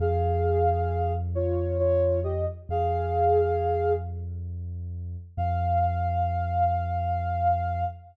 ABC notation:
X:1
M:3/4
L:1/16
Q:1/4=67
K:Fm
V:1 name="Ocarina"
[Af]6 [Fd]2 [Fd]2 [Ge] z | [Af]6 z6 | f12 |]
V:2 name="Synth Bass 2" clef=bass
F,,12 | F,,12 | F,,12 |]